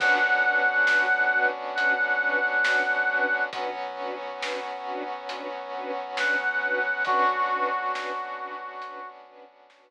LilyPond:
<<
  \new Staff \with { instrumentName = "Brass Section" } { \time 4/4 \key b \dorian \tempo 4 = 68 fis''2 fis''2 | r2. fis''4 | fis'4 fis'4. r4. | }
  \new Staff \with { instrumentName = "String Ensemble 1" } { \time 4/4 \key b \dorian <cis' d' fis' b'>8 <cis' d' fis' b'>8 <cis' d' fis' b'>8 <cis' d' fis' b'>8 <cis' d' fis' b'>8 <cis' d' fis' b'>8 <cis' d' fis' b'>8 <cis' d' fis' b'>8 | <cis' d' fis' b'>8 <cis' d' fis' b'>8 <cis' d' fis' b'>8 <cis' d' fis' b'>8 <cis' d' fis' b'>8 <cis' d' fis' b'>8 <cis' d' fis' b'>8 <cis' d' fis' b'>8 | <cis' d' fis' b'>8 <cis' d' fis' b'>8 <cis' d' fis' b'>8 <cis' d' fis' b'>8 <cis' d' fis' b'>8 <cis' d' fis' b'>8 <cis' d' fis' b'>8 r8 | }
  \new Staff \with { instrumentName = "Synth Bass 2" } { \clef bass \time 4/4 \key b \dorian b,,1 | b,,1 | b,,1 | }
  \new Staff \with { instrumentName = "Brass Section" } { \time 4/4 \key b \dorian <b cis' d' fis'>1 | <fis b cis' fis'>1 | <b cis' d' fis'>1 | }
  \new DrumStaff \with { instrumentName = "Drums" } \drummode { \time 4/4 <cymc bd>4 sn4 hh4 sn4 | <hh bd>4 sn4 hh4 sn4 | <hh bd>4 sn4 hh4 sn4 | }
>>